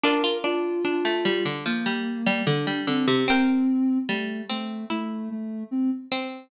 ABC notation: X:1
M:4/4
L:1/16
Q:1/4=74
K:Dm
V:1 name="Harpsichord"
[Fd]16 | [Bg]16 |]
V:2 name="Ocarina"
B2 F6 B,4 D2 C2 | C4 A,2 A,2 A,2 A,2 C z3 |]
V:3 name="Pizzicato Strings"
D F D2 D A, G, D, F, G,2 G, D, G, D, C, | C4 G,2 C2 E4 z2 C2 |]